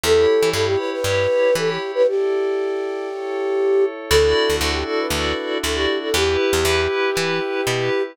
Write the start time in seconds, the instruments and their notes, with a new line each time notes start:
0.03 electric bass (finger) E2, electric piano 2 E4 G4 C#5, pad 5 (bowed) E4 G4 C#5, flute A4
0.42 electric bass (finger) E3
0.53 electric bass (finger) G2, electric piano 2 E4 G4 C#5, flute A4
0.66 flute G4
0.78 flute B4
0.92 flute B4
1.04 electric bass (finger) G2, electric piano 2 E4 G4 C#5
1.55 electric bass (finger) E3, electric piano 2 E4 G4 C#5, flute A4
1.68 flute G4
1.95 flute B4
2.07 pad 5 (bowed) E4 A4 D5, flute G4
3.09 pad 5 (bowed) E4 A4 C#5
4.10 electric bass (finger) D2, pad 5 (bowed) D4 E4 F#4 A4, electric piano 2 E4 F#4 A4 D5, flute A4
4.50 electric bass (finger) D2
4.59 electric bass (finger) D2, electric piano 2 E4 F#4 A4 D5, flute A4
4.72 flute G4
4.87 flute A4
4.99 flute B4
5.10 electric bass (finger) D2, electric piano 2 E4 F#4 A4 D5
5.63 electric bass (finger) D2, electric piano 2 E4 F#4 A4 D5, flute A4
5.75 flute G4
6.03 flute A4
6.14 electric bass (finger) E2, electric piano 2 E4 G4 B4, pad 5 (bowed) E4 G4 B4, flute G4
6.53 electric bass (finger) E2
6.65 electric bass (finger) E2, electric piano 2 E4 G4 B4
7.15 electric bass (finger) E3, electric piano 2 E4 G4 B4
7.67 electric bass (finger) B2, electric piano 2 E4 G4 B4